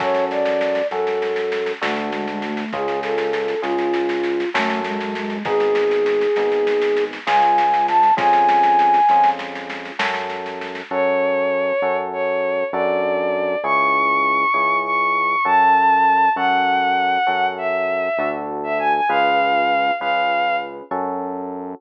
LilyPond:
<<
  \new Staff \with { instrumentName = "Flute" } { \time 9/8 \key fis \minor \tempo 4. = 66 cis''8 d''4 a'4. a8 gis16 gis16 a8 | gis'8 a'4 eis'4. a8 gis16 gis16 gis8 | gis'2. gis''4 a''8 | gis''2 r2 r8 |
r1 r8 | r1 r8 | r1 r8 | r1 r8 | }
  \new Staff \with { instrumentName = "Violin" } { \time 9/8 \key fis \minor r1 r8 | r1 r8 | r1 r8 | r1 r8 |
cis''2 cis''4 d''4. | cis'''2 cis'''4 a''4. | fis''2 e''4~ e''16 r8 e''16 gis''16 gis''16 | eis''4. eis''4 r2 | }
  \new Staff \with { instrumentName = "Electric Piano 1" } { \time 9/8 \key fis \minor <cis' fis' a'>4. <cis' fis' a'>4. <d' fis' a'>4. | <cis' eis' gis'>4. <cis' eis' gis'>4. <cis' fis' a'>4. | <b dis' gis'>4. <b dis' gis'>4. <cis' eis' gis'>4. | <cis' eis' gis'>4. <cis' eis' gis'>4. <cis' fis' a'>4. |
<cis' fis' a'>4. <cis' fis' a'>4. <d' fis' a'>4. | <cis' e' gis'>4. <cis' e' gis'>4. <cis' fis' a'>4. | <cis' fis' a'>4. <cis' fis' a'>4. <d' fis' a'>4. | <cis' eis' gis' b'>4. <cis' eis' gis' b'>4. <cis' fis' a'>4. | }
  \new Staff \with { instrumentName = "Synth Bass 1" } { \clef bass \time 9/8 \key fis \minor fis,4. fis,4. d,4. | cis,4. cis,4. fis,4. | gis,,4. gis,,4. cis,4. | eis,4. eis,4. fis,4. |
fis,4. fis,4. fis,4. | cis,4. cis,4. fis,4. | fis,4. fis,4. d,4. | cis,4. cis,4. fis,4. | }
  \new DrumStaff \with { instrumentName = "Drums" } \drummode { \time 9/8 <bd sn>16 sn16 sn16 sn16 sn16 sn16 sn16 sn16 sn16 sn16 sn16 sn16 sn16 sn16 sn16 sn16 sn16 sn16 | <bd sn>16 sn16 sn16 sn16 sn16 sn16 sn16 sn16 sn16 sn16 sn16 sn16 sn16 sn16 sn16 sn16 sn16 sn16 | <bd sn>16 sn16 sn16 sn16 sn16 sn16 sn16 sn16 sn16 sn16 sn16 sn16 sn16 sn16 sn16 sn16 sn16 sn16 | <bd sn>16 sn16 sn16 sn16 sn16 sn16 sn16 sn16 sn16 sn16 sn16 sn16 sn16 sn16 sn16 sn16 sn16 sn16 |
r4. r4. r4. | r4. r4. r4. | r4. r4. r4. | r4. r4. r4. | }
>>